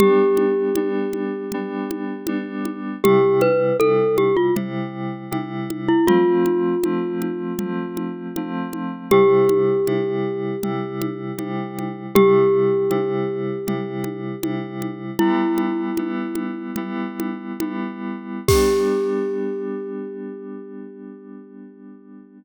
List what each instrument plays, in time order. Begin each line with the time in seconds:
0.00 electric piano 2 G3 B3 D4, glockenspiel G4, low conga
0.37 high conga
0.75 electric piano 2 G3 B3 D4, high conga
1.13 high conga
1.52 electric piano 2 G3 B3 D4, low conga
1.91 high conga
2.27 electric piano 2 G3 B3 D4, high conga
2.65 high conga
3.03 electric piano 2 C3 G3 E4, glockenspiel G4, low conga
3.41 glockenspiel B4, high conga
3.80 electric piano 2 C3 G3 E4, glockenspiel A4, high conga
4.18 glockenspiel G4, high conga
4.37 glockenspiel F4
4.55 electric piano 2 C3 G3 E4, low conga
5.31 electric piano 2 C3 G3 E4, high conga
5.70 high conga
5.88 glockenspiel E4
6.07 electric piano 2 F3 A3 C4, glockenspiel F4, low conga
6.46 high conga
6.84 electric piano 2 F3 A3 C4, high conga
7.22 high conga
7.59 electric piano 2 F3 A3 C4, low conga
7.97 high conga
8.36 electric piano 2 F3 A3 C4, high conga
8.73 high conga
9.11 electric piano 2 C3 G3 E4, glockenspiel G4, low conga
9.49 high conga
9.87 electric piano 2 C3 G3 E4, high conga
10.63 electric piano 2 C3 G3 E4, low conga
11.02 high conga
11.38 electric piano 2 C3 G3 E4, high conga
11.79 high conga
12.15 electric piano 2 C3 G3 E4, glockenspiel G4, low conga
12.90 electric piano 2 C3 G3 E4, high conga
13.67 electric piano 2 C3 G3 E4, low conga
14.04 high conga
14.42 electric piano 2 C3 G3 E4, high conga
14.82 high conga
15.19 electric piano 2 G3 B3 E4, glockenspiel E4, low conga
15.58 high conga
15.97 electric piano 2 G3 B3 E4, high conga
16.35 high conga
16.76 electric piano 2 G3 B3 E4, low conga
17.20 high conga
17.60 electric piano 2 G3 B3 E4, high conga
18.48 electric piano 2 G3 B3 D4, glockenspiel G4, kick, crash